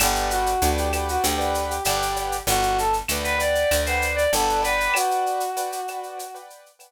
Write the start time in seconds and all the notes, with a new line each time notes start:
0.00 G1 G4 B4 D5 F#5 G5, cowbell, claves, shaker
0.15 shaker
0.31 F#4, shaker
0.46 shaker
0.62 D2 B4 D5 F#5 G5, shaker
0.78 G4, shaker
0.93 G4 B4 D5 F#5 G5, claves, shaker
1.09 F#4, shaker
1.23 D2 G4, cowbell, shaker
1.38 B4 D5 F#5 G5, shaker
1.55 shaker
1.69 G4, shaker
1.84 G1 G4 B4 D5 F#5 G5, cowbell, claves, shaker
2.02 shaker
2.16 cowbell, shaker
2.32 shaker
2.47 G1 F#4, cowbell, shaker
2.63 shaker
2.78 A4, shaker
2.93 shaker
3.08 D2 B4 D5 F#5 G5, claves, shaker
3.24 B4, shaker
3.38 B4 D5 F#5 G5, shaker
3.55 shaker
3.71 D2, cowbell, claves, shaker
3.86 B4 C5 D5 F#5 G5, shaker
4.02 shaker
4.16 D5, shaker
4.32 G1 A4 B4 D5 F#5 G5, cowbell, shaker
4.49 shaker
4.62 B4 D5 F#5 G5, cowbell, shaker
4.80 shaker
4.94 F#4, cowbell, claves, shaker
5.11 shaker
5.26 shaker
5.40 shaker
5.57 B4 D5 F#5 G5, shaker
5.72 shaker
5.88 B4 D5 F#5 G5, claves, shaker
6.03 shaker
6.19 cowbell, shaker
6.34 B4 D5 F#5 G5, shaker
6.50 shaker
6.66 shaker
6.79 B4 D5 F#5 G5, cowbell, claves, shaker